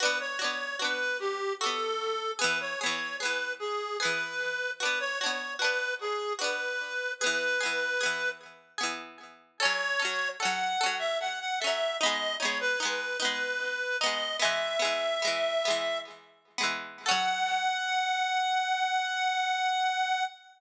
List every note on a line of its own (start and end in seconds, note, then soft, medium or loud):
0.00 0.37 D4 medium
0.00 0.37 F#4 medium
0.00 0.18 B4 medium
0.05 0.37 B3 medium
0.20 0.39 C#5 medium
0.39 0.76 D4 medium
0.39 0.76 F#4 medium
0.39 0.76 C#5 medium
0.44 0.76 B3 medium
0.79 1.53 D4 medium
0.79 1.53 F#4 medium
0.79 1.18 B4 medium
0.85 1.53 B3 medium
1.20 1.53 G4 medium
1.61 2.35 D4 medium
1.61 2.35 F#4 medium
1.61 2.31 A4 medium
1.66 2.35 B3 medium
2.39 2.76 B3 medium
2.39 2.76 G#4 medium
2.39 2.59 B4 medium
2.44 2.76 E3 medium
2.60 2.80 C#5 medium
2.80 3.18 B3 medium
2.80 3.18 G#4 medium
2.80 3.17 C#5 medium
2.86 3.18 E3 medium
3.20 3.94 B3 medium
3.20 3.94 G#4 medium
3.20 3.53 B4 medium
3.25 3.94 E3 medium
3.59 3.97 G#4 medium
4.00 4.74 B3 medium
4.00 4.74 G#4 medium
4.00 4.71 B4 medium
4.05 4.74 E3 medium
4.80 5.17 D4 medium
4.80 5.17 F#4 medium
4.80 4.99 B4 medium
4.85 5.17 B3 medium
5.00 5.19 C#5 medium
5.21 5.58 D4 medium
5.21 5.58 F#4 medium
5.21 5.54 C#5 medium
5.26 5.58 B3 medium
5.59 6.33 D4 medium
5.59 6.33 F#4 medium
5.59 5.94 B4 medium
5.64 6.33 B3 medium
6.01 6.33 G#4 medium
6.39 7.12 D4 medium
6.39 7.12 F#4 medium
6.39 7.12 B4 medium
6.44 7.12 B3 medium
7.20 7.58 B3 medium
7.20 7.58 G#4 medium
7.20 8.29 B4 medium
7.26 7.58 E3 medium
7.61 7.97 B3 medium
7.61 7.97 G#4 medium
7.66 7.97 E3 medium
8.01 8.74 B3 medium
8.01 8.74 G#4 medium
8.06 8.74 E3 medium
8.78 9.52 B3 medium
8.78 9.52 G#4 medium
8.83 9.52 E3 medium
9.60 9.97 C#4 medium
9.60 9.97 A4 loud
9.60 10.29 C#5 loud
9.65 9.97 F#3 medium
10.00 10.36 C#4 medium
10.00 10.36 A4 medium
10.05 10.36 F#3 medium
10.40 10.77 C#4 medium
10.40 10.77 A4 medium
10.40 10.96 F#5 medium
10.45 10.77 F#3 medium
10.81 11.54 C#4 medium
10.81 11.54 A4 medium
10.86 11.54 F#3 medium
10.99 11.18 E5 medium
11.20 11.39 F#5 medium
11.40 11.59 F#5 medium
11.60 11.98 A4 medium
11.60 11.97 E5 medium
11.64 11.98 F#3 medium
11.64 11.98 C#4 medium
12.00 12.38 B3 loud
12.00 12.38 D#4 medium
12.00 12.35 D#5 medium
12.06 12.38 G#3 medium
12.40 12.77 B3 medium
12.40 12.77 D#4 medium
12.40 12.59 C#5 medium
12.45 12.77 G#3 medium
12.60 12.79 B4 medium
12.80 13.17 B3 medium
12.80 13.17 D#4 medium
12.80 13.17 B4 medium
12.85 13.17 G#3 medium
13.20 13.93 B3 medium
13.20 13.93 D#4 medium
13.20 13.97 B4 medium
13.25 13.93 G#3 medium
14.00 14.38 B3 medium
14.00 14.38 D#4 medium
14.00 14.36 D#5 medium
14.06 14.38 G#3 medium
14.40 14.77 G#3 loud
14.40 14.77 B3 medium
14.40 15.99 E5 medium
14.45 14.77 E3 medium
14.79 15.18 G#3 medium
14.79 15.18 B3 medium
14.85 15.18 E3 medium
15.22 15.62 G#3 medium
15.22 15.62 B3 medium
15.27 15.62 E3 medium
15.65 16.49 G#3 medium
15.65 16.49 B3 medium
15.70 16.49 E3 medium
16.58 17.03 G#3 medium
16.58 17.03 B3 medium
16.63 17.03 E3 medium
17.06 20.24 C#4 loud
17.06 20.24 A4 loud
17.06 20.24 F#5 loud
17.11 20.24 F#3 loud